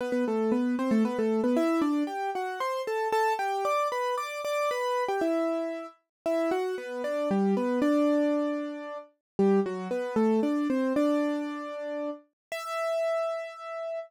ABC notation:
X:1
M:3/4
L:1/16
Q:1/4=115
K:Em
V:1 name="Acoustic Grand Piano"
[B,B] [B,B] [A,A]2 [B,B]2 [Cc] [A,A] [B,B] [A,A]2 [B,B] | [Ee]2 [Dd]2 [Gg]2 [Ff]2 [cc']2 [Aa]2 | [Aa]2 [Gg]2 [dd']2 [Bb]2 [dd']2 [dd']2 | [Bb]3 [Gg] [Ee]6 z2 |
[Ee]2 [Ff]2 [B,B]2 [Dd]2 [G,G]2 [B,B]2 | [Dd]10 z2 | [G,G]2 [F,F]2 [B,B]2 [A,A]2 [Dd]2 [Cc]2 | [Dd]10 z2 |
e12 |]